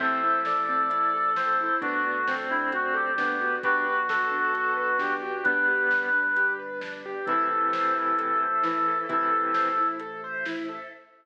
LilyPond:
<<
  \new Staff \with { instrumentName = "Brass Section" } { \time 4/4 \key a \minor \tempo 4 = 132 a'1 | fis'4. e'8 fis'8 g'4. | fis'1 | b'2~ b'8 r4. |
a'1 | a'2 r2 | }
  \new Staff \with { instrumentName = "Lead 1 (square)" } { \time 4/4 \key a \minor <c'' e''>4 d''2 c''4 | <b d'>4 c'2 b4 | <g' b'>4 a'2 g'4 | <g b>4. r2 r8 |
<c e>2. e4 | <c e>4. r2 r8 | }
  \new Staff \with { instrumentName = "Acoustic Grand Piano" } { \time 4/4 \key a \minor c'8 e'8 a'8 c'8 e'8 a'8 c'8 e'8 | d'8 fis'8 a'8 d'8 fis'8 a'8 d'8 fis'8 | d'8 fis'8 b'8 d'8 fis'8 b'8 d'8 fis'8 | d'8 g'8 b'8 d'8 g'8 b'8 d'8 g'8 |
e'8 a'8 c''8 e'8 a'8 c''8 e'8 a'8 | e'8 a'8 c''8 e'8 a'8 c''8 e'8 a'8 | }
  \new Staff \with { instrumentName = "Synth Bass 2" } { \clef bass \time 4/4 \key a \minor a,,1 | d,1 | b,,1 | g,,1 |
a,,1 | a,,1 | }
  \new Staff \with { instrumentName = "Choir Aahs" } { \time 4/4 \key a \minor <c' e' a'>2 <a c' a'>2 | <d' fis' a'>2 <d' a' d''>2 | <d' fis' b'>2 <b d' b'>2 | <d' g' b'>2 <d' b' d''>2 |
<e' a' c''>2 <e' c'' e''>2 | <e' a' c''>2 <e' c'' e''>2 | }
  \new DrumStaff \with { instrumentName = "Drums" } \drummode { \time 4/4 <cymc bd>4 sn4 hh4 sn4 | <hh bd>4 sn4 hh4 sn4 | <hh bd>4 sn4 hh4 sn4 | <hh bd>4 sn4 hh4 sn4 |
<hh bd>4 sn4 hh4 sn4 | <hh bd>4 sn4 hh4 sn4 | }
>>